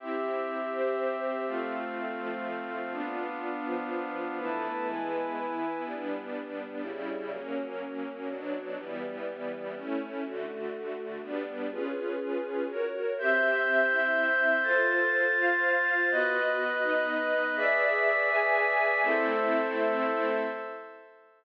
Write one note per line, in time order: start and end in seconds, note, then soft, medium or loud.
0.00 0.72 C4 medium
0.00 1.44 C4 medium
0.00 0.72 E4 medium
0.00 0.72 G4 medium
0.00 1.44 G4 medium
0.00 1.44 E5 medium
0.73 1.46 C4 medium
0.73 1.46 G4 medium
0.73 1.46 C5 medium
1.47 2.19 A3 medium
1.47 2.92 A3 medium
1.47 2.19 C4 medium
1.47 2.92 C4 medium
1.47 2.19 F4 medium
1.47 2.91 F5 medium
2.19 2.92 F3 medium
2.19 2.92 A3 medium
2.19 2.92 F4 medium
2.92 4.37 B3 medium
2.92 3.65 B3 medium
2.92 4.37 D4 medium
2.92 3.65 D4 medium
2.92 3.65 F4 medium
2.92 4.37 F5 medium
3.66 4.38 F3 medium
3.66 4.38 B3 medium
3.66 4.38 F4 medium
4.39 4.87 E3 medium
4.39 4.88 A3 medium
4.39 4.87 B3 medium
4.39 4.87 E4 medium
4.39 4.87 B4 medium
4.39 4.87 A5 medium
4.88 5.36 E3 medium
4.88 5.36 G#3 medium
4.88 5.36 B3 medium
4.88 5.85 E4 medium
4.88 5.85 B4 medium
4.88 5.85 G#5 medium
5.36 5.85 E3 medium
5.36 5.85 B3 medium
5.36 5.85 E4 medium
5.85 6.82 G3 medium
5.85 6.82 B3 medium
5.85 6.82 D4 medium
6.83 7.31 C#3 medium
6.83 7.31 G3 medium
6.83 7.31 E4 medium
7.32 8.28 F#3 medium
7.32 8.28 A#3 medium
7.32 8.28 C#4 medium
8.29 8.77 B2 medium
8.29 8.77 F#3 medium
8.29 8.77 D4 medium
8.78 9.75 E3 medium
8.78 9.75 G3 medium
8.78 9.75 B3 medium
9.75 10.24 A3 medium
9.75 10.24 C#4 medium
9.75 10.24 E4 medium
10.24 11.21 D3 medium
10.24 11.21 A3 medium
10.24 11.21 F#4 medium
11.22 11.70 G3 medium
11.22 11.70 B3 medium
11.22 11.70 D4 medium
11.71 12.67 C#4 medium
11.71 12.67 F4 medium
11.71 12.67 G#4 medium
11.71 12.67 B4 medium
12.68 13.16 F#4 medium
12.68 13.16 A#4 medium
12.68 13.16 C#5 medium
13.17 13.89 C4 medium
13.17 13.89 G4 medium
13.17 14.62 C5 medium
13.17 13.89 E5 medium
13.17 14.63 E5 medium
13.17 14.63 G6 loud
13.90 14.63 C4 medium
13.90 14.63 E4 medium
13.90 14.63 E5 medium
14.63 16.08 F4 loud
14.63 15.35 F4 medium
14.63 15.35 A4 medium
14.63 16.08 C5 medium
14.63 15.35 C5 medium
14.63 16.08 A6 medium
15.37 16.09 F4 medium
15.37 16.09 C5 medium
15.37 16.09 F5 medium
16.10 16.82 B3 medium
16.10 16.82 F#4 medium
16.10 17.56 B4 loud
16.10 16.82 D#5 medium
16.10 17.56 D#5 loud
16.10 17.56 F#6 loud
16.83 17.55 B3 medium
16.83 17.55 D#4 medium
16.83 17.55 D#5 medium
17.56 18.28 G#4 medium
17.56 19.01 G#4 medium
17.56 18.28 B4 medium
17.56 18.28 D5 medium
17.56 19.01 D5 loud
17.56 18.28 E5 medium
17.56 19.01 E5 medium
17.56 19.01 B6 loud
18.30 19.02 G#4 medium
18.30 19.02 B4 medium
18.30 19.02 E5 medium
18.30 19.02 G#5 medium
19.02 20.40 A3 loud
19.02 20.40 C4 loud
19.02 20.40 E4 loud
19.02 20.42 A4 loud
19.02 20.42 C5 medium
19.02 20.42 E5 loud